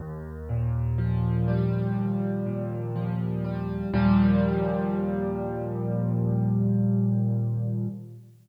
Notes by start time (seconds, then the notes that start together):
0.00 D#2
0.49 A#2
0.98 F3
1.48 G3
1.97 D#2
2.46 A#2
2.95 F3
3.44 G3
3.93 D#2 A#2 F3 G3